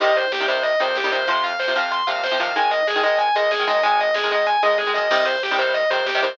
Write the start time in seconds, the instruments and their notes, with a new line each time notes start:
0.00 synth bass 1 C2, overdriven guitar C3 D#3 G3, distortion guitar D#5, kick, closed hi-hat
0.08 kick
0.16 distortion guitar C5, kick, closed hi-hat
0.24 kick
0.32 synth bass 1 C2, distortion guitar G4, kick, snare
0.40 overdriven guitar C3 D#3 G3, kick
0.48 overdriven guitar C3 D#3 G3, distortion guitar C5, kick, closed hi-hat
0.56 kick
0.63 distortion guitar D#5, kick, closed hi-hat
0.72 kick
0.79 synth bass 1 F2, overdriven guitar C3 D#3 G3, distortion guitar C5, kick, closed hi-hat
0.88 kick
0.96 synth bass 1 C2, distortion guitar G4, kick, snare
1.04 overdriven guitar C3 D#3 G3, kick
1.11 synth bass 1 A#2, overdriven guitar C3 D#3 G3, distortion guitar C5, kick, closed hi-hat
1.19 kick
1.27 synth bass 1 F2, overdriven guitar C3 F3, distortion guitar C6, kick, closed hi-hat
1.36 kick
1.44 distortion guitar F5, kick, closed hi-hat
1.51 kick
1.59 synth bass 1 F2, distortion guitar C5, kick, snare
1.68 overdriven guitar C3 F3, kick
1.75 overdriven guitar C3 F3, distortion guitar F5, kick, closed hi-hat
1.84 kick
1.91 distortion guitar C6, kick, closed hi-hat
1.99 kick
2.07 synth bass 1 A#2, overdriven guitar C3 F3, distortion guitar F5, kick, closed hi-hat
2.15 kick
2.23 synth bass 1 F2, distortion guitar C5, kick, snare
2.31 overdriven guitar C3 F3, kick
2.39 overdriven guitar C3 F3, synth bass 1 D#3, distortion guitar F5, kick, closed hi-hat
2.47 kick
2.56 synth bass 1 G#1, overdriven guitar D#3 G#3, distortion guitar G#5, kick, closed hi-hat
2.63 kick
2.71 distortion guitar D#5, kick, closed hi-hat
2.79 kick
2.87 synth bass 1 G#1, distortion guitar G#4, kick, snare
2.95 overdriven guitar D#3 G#3, kick
3.03 overdriven guitar D#3 G#3, distortion guitar D#5, kick, closed hi-hat
3.11 kick
3.18 distortion guitar G#5, kick, closed hi-hat
3.27 kick
3.35 synth bass 1 C#2, overdriven guitar D#3 G#3, distortion guitar D#5, kick, closed hi-hat
3.43 kick
3.51 synth bass 1 G#1, distortion guitar G#4, kick, snare
3.59 overdriven guitar D#3 G#3, kick
3.66 synth bass 1 F#2, overdriven guitar D#3 G#3, distortion guitar D#5, kick, closed hi-hat
3.75 kick
3.83 synth bass 1 G#1, overdriven guitar D#3 G#3, distortion guitar G#5, kick, closed hi-hat
3.91 kick
3.99 distortion guitar D#5, kick, closed hi-hat
4.07 kick
4.14 synth bass 1 G#1, distortion guitar G#4, kick, snare
4.23 overdriven guitar D#3 G#3, kick
4.31 overdriven guitar D#3 G#3, distortion guitar D#5, kick, closed hi-hat
4.39 kick
4.46 distortion guitar G#5, kick, closed hi-hat
4.55 kick
4.62 synth bass 1 C#2, overdriven guitar D#3 G#3, distortion guitar D#5, kick, closed hi-hat
4.70 kick
4.77 synth bass 1 G#1, distortion guitar G#4, kick, snare
4.87 overdriven guitar D#3 G#3
4.94 synth bass 1 F#2, overdriven guitar D#3 G#3, distortion guitar D#5, mid tom
5.10 synth bass 1 C2, overdriven guitar C3 D#3 G3, distortion guitar D#5, kick, crash
5.18 kick
5.25 distortion guitar C5, kick, closed hi-hat
5.35 kick
5.42 synth bass 1 C2, distortion guitar G4, kick, snare
5.51 overdriven guitar C3 D#3 G3, kick
5.58 overdriven guitar C3 D#3 G3, distortion guitar C5, kick, closed hi-hat
5.67 kick
5.74 distortion guitar D#5, kick, closed hi-hat
5.82 kick
5.90 synth bass 1 F2, overdriven guitar C3 D#3 G3, distortion guitar C5, kick, closed hi-hat
5.99 kick
6.06 synth bass 1 C2, distortion guitar G4, kick, snare
6.14 overdriven guitar C3 D#3 G3, kick
6.21 synth bass 1 A#2, overdriven guitar C3 D#3 G3, distortion guitar C5, kick, closed hi-hat
6.31 kick